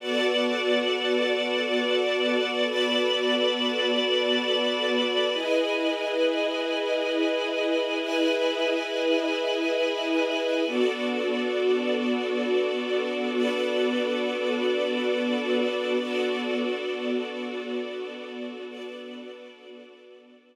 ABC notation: X:1
M:4/4
L:1/8
Q:"Swing 16ths" 1/4=90
K:Bdor
V:1 name="String Ensemble 1"
[Bdfa]8 | [Bdab]8 | [EB^dg]8 | [EBeg]8 |
[B,DFA]8 | [B,DAB]8 | [B,DFA]8 | [B,DAB]8 |]
V:2 name="String Ensemble 1"
[B,FAd]8- | [B,FAd]8 | [EGB^d]8- | [EGB^d]8 |
[B,FAd]8- | [B,FAd]8 | [B,FAd]8- | [B,FAd]8 |]